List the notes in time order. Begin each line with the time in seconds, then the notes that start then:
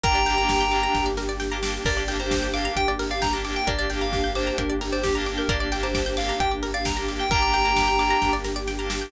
0.04 G1 A#3 D4 G4 A#4 G5 A#5, kick, closed hi-hat
0.15 D5
0.26 A#3 D4 G4 G5, open hi-hat
0.38 A#3 D4 G4 A#5
0.49 D6, kick, snare
0.61 G6
0.71 A#3 D4 G4 D6, open hi-hat
0.83 A#5
0.95 G1 G5, kick, snare
1.06 D5
1.17 A#4, snare
1.29 D5
1.40 G5, snare
1.51 A#3 D4 G4 A#5
1.63 A#3 D4 G4 D6, snare
1.74 G6
1.85 G1 A#3 D4 G4 A#4 D5, kick, crash
1.97 D5
2.08 A#3 D4 G4 G5, open hi-hat
2.20 A#3 D4 G4 C5 A#5
2.31 D6, kick, snare
2.43 G6
2.54 A#3 D4 G4 F5 D6, open hi-hat
2.65 A#5
2.76 G1 G5, kick, closed hi-hat
2.88 D5
2.99 A#4, open hi-hat
3.11 D5 F5
3.22 G5 A#5, kick, snare
3.33 A#3 D4 G4 A#5
3.44 A#3 D4 G4 D6, open hi-hat
3.56 G5 G6
3.67 G1 A#3 D4 G4 A#4 D5, kick, closed hi-hat
3.79 D5
3.90 A#3 D4 G4 G5, open hi-hat
4.01 A#3 D4 G4 F5 A#5
4.13 D6, kick, snare
4.24 G6
4.35 A#3 D4 G4 C5 D6, open hi-hat
4.47 A#5
4.58 G1 A#4 G5, kick, closed hi-hat
4.70 D5
4.81 A#4, open hi-hat
4.92 C5 D5
5.03 G4 G5, kick, snare
5.15 A#3 D4 G4 A#5
5.26 A#3 D4 G4 D6, open hi-hat
5.38 A#4 G6
5.48 G1 A#3 D4 G4 A#4 D5, kick, closed hi-hat
5.60 D5
5.72 A#3 D4 G4 G5, open hi-hat
5.83 A#3 D4 G4 C5 A#5
5.94 D6, kick, snare
6.06 G6
6.17 A#3 D4 G4 F5 D6, open hi-hat
6.29 A#5
6.40 G1 G5, kick, closed hi-hat
6.51 D5
6.63 A#4, open hi-hat
6.74 D5 F5
6.85 G5 A#5, kick, snare
6.96 A#3 D4 G4 A#5
7.08 A#3 D4 G4 D6, open hi-hat
7.20 G5 G6
7.30 G1 A#3 D4 G4 A#4 G5 A#5, kick, closed hi-hat
7.42 D5
7.52 A#3 D4 G4 G5, open hi-hat
7.64 A#3 D4 G4 A#5
7.76 D6, kick, snare
7.88 G6
7.99 A#3 D4 G4 D6, open hi-hat
8.11 A#5
8.22 G1 G5, kick, snare
8.33 D5
8.44 A#4, snare
8.56 D5
8.67 G5, snare
8.79 A#3 D4 G4 A#5
8.90 A#3 D4 G4 D6, snare
9.02 G6